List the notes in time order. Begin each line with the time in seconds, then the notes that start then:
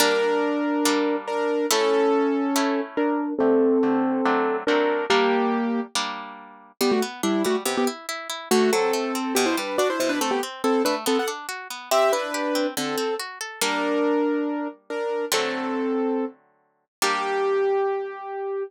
0.00 G3 A#3 D4 A#4
0.85 G3 A#3 D4
1.27 D4 A#4
1.71 A3 C#4 E4 A4
2.56 A3 C#4 E4
2.97 D4 A#4
3.39 D3 A3 C4 G4 A4
3.83 D3 A3 C4 G4
4.25 F#3 A3 C4 D4
4.67 F#3 A3 C4 D4 A#4
5.10 G3 A#3 D4 G4
5.95 G3 A#3 D4
6.81 G3 B3 G4
6.91 A3 F#4
7.02 B3
7.23 G3 D4 E4
7.45 G3 A3 F#4
7.65 C3 B3 G4
7.77 B3 G4
7.87 E4
8.09 E4
8.30 E4
8.51 D3 A3 F#4
8.73 F#3 C4 A4
8.93 A3
9.15 C4
9.35 B2 B3 G4
9.46 E4 C5
9.57 G3 D4 B4
9.78 D4 F#4 D5
9.90 E4 C5
10.00 B2 E4 C5
10.09 D4 B4
10.21 A3 C4 A4
10.31 B3 G4
10.43 C4
10.64 C4 E4 A4
10.85 A3 D4 B4
11.06 B3 C4 A4
11.19 A4 F#5
11.28 D4
11.49 F#4
11.70 B3
11.91 C4 G4 E5
12.13 D4 E4 B4
12.34 G4
12.55 C4
12.77 D3 C4 A4
12.98 C4
13.20 F#4
13.41 A4
13.61 G3 A#3 D4 A#4
14.90 D4 A#4
15.32 D3 F#3 A3 C4 A4
17.02 G3 A#3 D4 G4